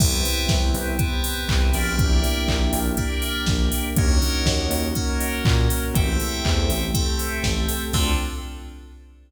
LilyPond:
<<
  \new Staff \with { instrumentName = "Electric Piano 2" } { \time 4/4 \key d \minor \tempo 4 = 121 <b' c'' e'' g''>2 <b' c'' e'' g''>4. <bes' d'' e'' g''>8~ | <bes' d'' e'' g''>2 <bes' d'' e'' g''>2 | <bes' des'' ees'' ges''>2 <bes' des'' ees'' ges''>2 | <a' c'' e'' g''>2 <a' c'' e'' g''>2 |
<c' d' f' a'>4 r2. | }
  \new Staff \with { instrumentName = "Synth Bass 1" } { \clef bass \time 4/4 \key d \minor c,4 c,8 c,4. c,8 bes,,8~ | bes,,4 bes,,8 bes,,4. bes,,4 | ees,4 ees,8 ees,4. bes,4 | a,,4 e,8 a,,4. a,,4 |
d,4 r2. | }
  \new Staff \with { instrumentName = "Pad 5 (bowed)" } { \time 4/4 \key d \minor <b c' e' g'>2 <b c' g' b'>2 | <bes d' e' g'>2 <bes d' g' bes'>2 | <bes des' ees' ges'>2 <bes des' ges' bes'>2 | <a c' e' g'>2 <a c' g' a'>2 |
<c' d' f' a'>4 r2. | }
  \new DrumStaff \with { instrumentName = "Drums" } \drummode { \time 4/4 <cymc bd>8 hho8 <bd sn>8 hho8 <hh bd>8 hho8 <hc bd>8 hho8 | <hh bd>8 hho8 <hc bd>8 hho8 <hh bd>8 hho8 <bd sn>8 hho8 | <hh bd>8 hho8 <bd sn>8 hho8 <hh bd>8 hho8 <hc bd>8 hho8 | <hh bd>8 hho8 <hc bd>8 hho8 <hh bd>8 hho8 <bd sn>8 hho8 |
<cymc bd>4 r4 r4 r4 | }
>>